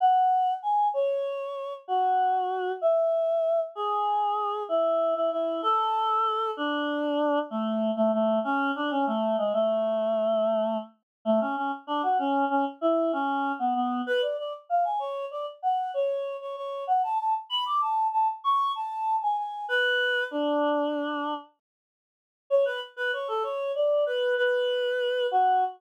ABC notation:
X:1
M:9/8
L:1/16
Q:3/8=64
K:F#m
V:1 name="Choir Aahs"
f4 g2 c6 F6 | e6 G6 E3 E E2 | A6 D6 A,3 A, A,2 | C2 D C A,2 G, A,9 z2 |
A, C C z D F C2 C z E2 C3 B, B,2 | B d d z ^e g c2 d z f2 c3 c c2 | f a a z b d' a2 a z c'2 a3 g g2 | B4 D8 z6 |
c B z B c A c2 d2 B2 B6 | F6 z12 |]